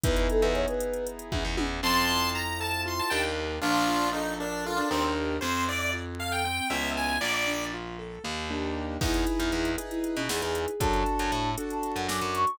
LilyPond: <<
  \new Staff \with { instrumentName = "Ocarina" } { \time 7/8 \key e \mixolydian \tempo 4 = 117 b'16 b'16 a'16 b'16 cis''16 b'8. r4. | \key f \mixolydian r2. r8 | r2. r8 | r2. r8 |
r2. r8 | \key e \mixolydian e'4. r16 e'8 cis'16 gis'8 gis'8 | a''4. r16 a''8 fis''16 d'''8 cis'''8 | }
  \new Staff \with { instrumentName = "Lead 1 (square)" } { \time 7/8 \key e \mixolydian r2. r8 | \key f \mixolydian <a'' c'''>4 bes''8 a''8 c'''16 a''16 g''16 r8. | <d' f'>4 ees'8 d'8 f'16 d'16 c'16 r8. | c''8 d''16 d''16 r8 f''16 g''16 g''8 fes''8 aes''8 |
d''16 d''8. r2 r8 | \key e \mixolydian r2. r8 | r2. r8 | }
  \new Staff \with { instrumentName = "Acoustic Grand Piano" } { \time 7/8 \key e \mixolydian <b dis' e' gis'>2.~ <b dis' e' gis'>8 | \key f \mixolydian c'8 e'8 f'8 a'8 f'8 <d' ees' g' bes'>4 | d'8 f'8 a'8 bes'8 a'8 <d' ees' g' bes'>4 | c'8 e'8 f'8 a'8 c'8 <ces' des' fes' aes'>4 |
bes8 d'8 f'8 a'8 bes8 <bes d' ees' g'>4 | \key e \mixolydian <dis' e' gis' b'>4. <dis' e' gis' b'>2 | <d' fis' a'>4. <d' fis' a'>2 | }
  \new Staff \with { instrumentName = "Electric Bass (finger)" } { \clef bass \time 7/8 \key e \mixolydian e,8. e,4.~ e,16 e,16 e,16 e,8 | \key f \mixolydian f,2~ f,8 ees,4 | bes,,2~ bes,,8 ees,4 | f,2~ f,8 des,4 |
bes,,2 ees,4. | \key e \mixolydian e,8. e,16 e,4~ e,16 b,16 e,16 e,8. | fis,8. fis,16 a,4~ a,16 fis,16 fis,16 fis,8. | }
  \new DrumStaff \with { instrumentName = "Drums" } \drummode { \time 7/8 <hh bd>16 hh16 hh16 hh16 hh16 hh16 hh16 hh16 hh16 hh16 <bd tommh>8 tommh8 | r4. r4 r4 | r4. r4 r4 | r4. r4 r4 |
r4. r4 r4 | <cymc bd>16 hh16 hh16 hh16 hh16 hh16 hh16 hh16 hh16 hh16 sn16 hh16 hh16 hh16 | <hh bd>16 hh16 hh16 hh16 hh8 hh16 hh16 hh16 hh16 sn16 hh16 hh16 hh16 | }
>>